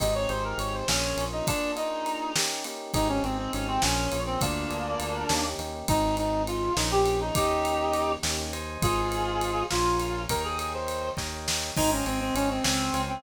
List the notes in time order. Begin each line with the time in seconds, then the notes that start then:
0.00 G#1 C4 D#4 G4 G#4 D#5, kick, ride
0.15 C#5
0.29 G#1 C4 D#4 G4 G#4 C5, ride
0.44 A#4
0.58 G#1 C#5, ride
0.74 C5
0.88 A#1 A#3 C#4 F4 G#4, snare
1.16 A#1 A#3 C#4 F4 G#4, ride
1.32 D#4
1.47 A#3 D4 F4 G#4, kick, ride
1.76 A#3 D4 D#4 F4 G#4, ride
2.06 ride
2.36 A#3 C#4 D#4 G4, snare
2.64 A#3 C#4 D#4 G4, ride
2.94 G#1 C4 D#4 G4 G#4, kick, ride
3.09 C#4
3.23 G#1 C4 D#4 G4 G#4, ride
3.38 C4
3.53 G#1 C#4, ride
3.68 C4
3.82 A#1 A#3 C#4 F4 G#4, snare
4.12 A#1 A#3 C#4 F4 G#4, ride
4.26 C4
4.41 D2 A#3 D4 F4 G#4, kick, ride
4.70 D2 A#3 D4 F4 G#4, ride
5.00 D2, ride
5.29 D#2 A#3 C#4 D#4 G4, snare
5.58 D#2 A#3 C#4 D#4 G4, ride
5.88 G#1 C4 D#4 G#4, kick, ride
6.17 D#4, ride
6.47 F4, ride
6.76 A#1 A#3 C#4 D#4 F4 G#4, snare
6.91 G4
7.06 ride
7.21 D#4
7.35 D#2 A#3 C#4 D#4 G4, kick, ride
7.65 ride
7.94 ride
8.23 D#2 A#3 C#4 D#4 G4, snare
8.53 C5 D#5 G#5, ride
8.82 G#1 F4 G#4, kick, ride
9.12 ride
9.41 ride
9.71 A#1 F4 A#4 C#5 F5 G#5, snare
10.00 ride
10.29 D#2 A#4 C#5 D#5 G5, kick, ride
10.44 G#4
10.59 G#4, ride
10.74 C5
10.88 ride
11.17 D#2 A#4 C#5 D#5 G5, kick, snare
11.48 snare
11.76 G#1 D#4 C5 D#5 G5 G#5, kick, crash
11.91 C#4
12.06 G#1 C4 C5 D#5 G5 G#5, ride
12.21 C4
12.35 G#1 C#4, ride
12.50 C4
12.64 C#2 C4 C5 C#5 F5 G#5, snare
12.93 C#2 C5 C#5 F5 G#5, ride
13.09 C4